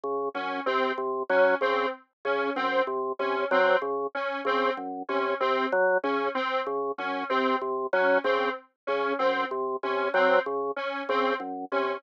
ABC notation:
X:1
M:6/4
L:1/8
Q:1/4=95
K:none
V:1 name="Drawbar Organ" clef=bass
^C, ^F,, | C, C, ^F, ^C, z C, ^F,, =C, C, F, ^C, z | ^C, ^F,, =C, C, ^F, ^C, z C, F,, =C, C, F, | ^C, z C, ^F,, =C, C, ^F, ^C, z C, F,, =C, |]
V:2 name="Lead 1 (square)"
z ^C | C z ^C =C z ^C =C z ^C =C z ^C | C z ^C =C z ^C =C z ^C =C z ^C | C z ^C =C z ^C =C z ^C =C z ^C |]